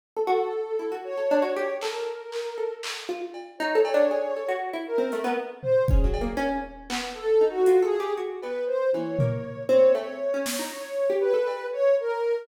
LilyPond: <<
  \new Staff \with { instrumentName = "Ocarina" } { \time 7/8 \tempo 4 = 118 r8 a'4. des''4. | bes'2 r4. | des''8 des''4. r8 bes'4 | r8 c''8 aes'4 r4. |
\tuplet 3/2 { a'4 ges'4 aes'4 } r8 b'8 c''8 | des''4. des''8 des''4. | des''4 b'4 des''8 bes'4 | }
  \new Staff \with { instrumentName = "Pizzicato Strings" } { \time 7/8 r16 a'16 ges'16 r8. e'16 ges'8 a'16 d'16 ges'16 g'16 r16 | a'4. a'8 r8 f'16 r8. | \tuplet 3/2 { ees'8 a'8 d'8 } aes'8 a'16 ges'8 e'16 r16 c'16 a16 b16 | r4 \tuplet 3/2 { des'8 ges8 bes8 } des'8 r8 b8 |
r8 ees'8 \tuplet 3/2 { f'8 a'8 g'8 } ges'8 b8 r8 | e8 bes4 c'8 a16 r8 des'16 r16 ees'16 | r8. g'8 a'16 r2 | }
  \new DrumStaff \with { instrumentName = "Drums" } \drummode { \time 7/8 r4 r4 r4. | hc4 hc4 hc4 cb8 | r8 cb8 r4 r4 hh8 | r8 tomfh8 bd8 cb8 r4 hc8 |
r4 hh4 r8 cb4 | tommh8 tomfh8 r8 tommh8 cb4 sn8 | r4 r8 cb8 r4. | }
>>